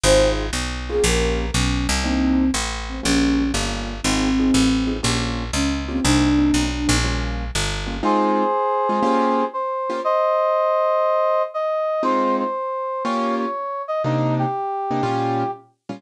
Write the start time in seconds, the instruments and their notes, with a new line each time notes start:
0.04 electric bass (finger) G#1, acoustic grand piano C4 D#4 F4 G#4, flute C5
0.53 electric bass (finger) B1
0.89 acoustic grand piano A#3 C#4 F4 G4, flute G#4
1.03 electric bass (finger) A#1, flute A#4
1.54 electric bass (finger) B1, flute C#4
1.89 electric bass (finger) C2
2.04 acoustic grand piano A#3 C4 D4 D#4, flute C4
2.54 electric bass (finger) A1
2.89 flute C4
3.03 electric bass (finger) A#1, acoustic grand piano G3 A#3 C#4 F4, flute C#4
3.54 electric bass (finger) G1, acoustic grand piano G3 A#3 C#4 F4
4.03 electric bass (finger) G#1, flute C4, acoustic grand piano C4 D#4 F4 G#4
4.39 acoustic grand piano C4 D#4 F4 G#4
4.54 electric bass (finger) A1
4.87 acoustic grand piano C4 D#4 F4 G#4
5.03 electric bass (finger) A#1, acoustic grand piano A#3 C#4 F4 G4
5.53 electric bass (finger) C#2, flute C#4
5.88 acoustic grand piano A#3 C#4 F4 G4, flute C4
6.04 electric bass (finger) C2, acoustic grand piano A#3 C4 D4 D#4, flute D4
6.39 acoustic grand piano A#3 C4 D4 D#4
6.54 electric bass (finger) B1
6.88 electric bass (finger) A#1, acoustic grand piano A#3 C4 D4 D#4
7.04 acoustic grand piano G3 A#3 C#4 F4
7.55 electric bass (finger) G1
7.87 acoustic grand piano G3 A#3 C#4 F4
8.03 acoustic grand piano G#3 C4 D#4 F4, brass section G#4 C5
8.89 acoustic grand piano G#3 C4 D#4 F4
9.03 acoustic grand piano A#3 C#4 F4 G4
9.53 brass section C5
9.90 acoustic grand piano A#3 C#4 F4 G4
10.04 brass section C5 D#5
11.54 brass section D#5
12.03 acoustic grand piano G#3 C4 D#4 F4, brass section C5
12.39 brass section C5
13.04 acoustic grand piano A#3 C#4 F4 G4, brass section C#5
13.38 brass section C#5
13.88 brass section D#5
14.04 acoustic grand piano C3 A#3 D4 D#4, brass section D#4
14.39 brass section G4
14.91 acoustic grand piano C3 A#3 D4 D#4
15.03 acoustic grand piano A#2 G3 C#4 F4
15.89 acoustic grand piano A#2 G3 C#4 F4